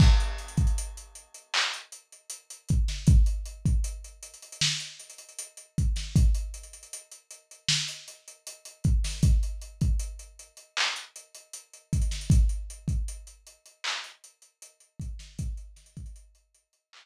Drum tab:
CC |x-------------------------------|--------------------------------|--------------------------------|--------------------------------|
HH |--x-xxxxx-x-x-x---x-x-x-x-x-x-x-|x-x-x-x-x-x-xxxx--x-xxxxx-x-x-x-|x-x-xxxxx-x-x-x---x-x-x-x-x-x-o-|x-x-x-x-x-x-x-x---x-x-x-x-x-xxxx|
CP |----------------x---------------|--------------------------------|--------------------------------|----------------x---------------|
SD |------------------------------o-|----------------o-------------o-|----------------o-------------o-|------------------------------o-|
BD |o-----o---------------------o---|o-----o---------------------o---|o---------------------------o---|o-----o---------------------o---|

CC |--------------------------------|--------------------------------|
HH |x-x-x-x-x-x-x-x---x-x-x-x-x-x-x-|x-x-xxxxx-x-x-x-----------------|
CP |----------------x---------------|----------------x---------------|
SD |------------------------------o-|----o---------------------------|
BD |o-----o---------------------o---|o-----o-------------------------|